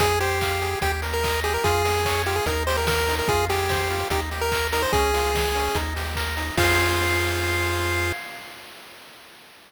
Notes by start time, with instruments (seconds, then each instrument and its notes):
0.00 synth bass 1 F2, lead 1 (square) G#4, kick, closed hi-hat
0.20 lead 1 (square) G4 C5, open hi-hat
0.41 lead 1 (square) F5, kick, clap
0.62 lead 1 (square) G#4, open hi-hat
0.81 synth bass 1 D#2, lead 1 (square) G4, kick, closed hi-hat
1.02 lead 1 (square) A#4, open hi-hat
1.14 lead 1 (square) A#4
1.23 lead 1 (square) D#5, kick, clap
1.44 lead 1 (square) G4 G#4, open hi-hat
1.54 lead 1 (square) A#4
1.64 synth bass 1 F2, lead 1 (square) F4 G#4, kick, closed hi-hat
1.85 lead 1 (square) G#4, open hi-hat
2.05 lead 1 (square) C#5, kick, clap
2.26 lead 1 (square) F4 G4, open hi-hat
2.36 lead 1 (square) G#4
2.46 synth bass 1 D#2, lead 1 (square) D#4 A#4, kick, closed hi-hat
2.67 lead 1 (square) G4 C5, open hi-hat
2.77 lead 1 (square) A#4
2.87 lead 1 (square) A#4, kick, snare
3.08 lead 1 (square) D#4, open hi-hat
3.19 lead 1 (square) A#4
3.28 synth bass 1 F2, lead 1 (square) F4 G#4, kick, closed hi-hat
3.49 lead 1 (square) G4 G#4, open hi-hat
3.69 lead 1 (square) C5, kick, snare
3.90 lead 1 (square) F4, open hi-hat
4.10 synth bass 1 D#2, lead 1 (square) D#4 G4, kick, closed hi-hat
4.31 lead 1 (square) G4, open hi-hat
4.41 lead 1 (square) A#4
4.52 lead 1 (square) A#4, kick, clap
4.72 lead 1 (square) D#4 A#4, open hi-hat
4.82 lead 1 (square) C5
4.93 synth bass 1 C#2, lead 1 (square) C#4 G#4, kick, closed hi-hat
5.14 lead 1 (square) F4, open hi-hat
5.35 lead 1 (square) G#4, kick, snare
5.55 lead 1 (square) C#4, open hi-hat
5.75 synth bass 1 D#2, lead 1 (square) D#4, kick, closed hi-hat
5.96 lead 1 (square) G4, open hi-hat
6.15 lead 1 (square) A#4, kick, clap
6.37 lead 1 (square) D#4, open hi-hat
6.57 synth bass 1 F2, lead 1 (square) F4 G#4 C5 F5, kick, crash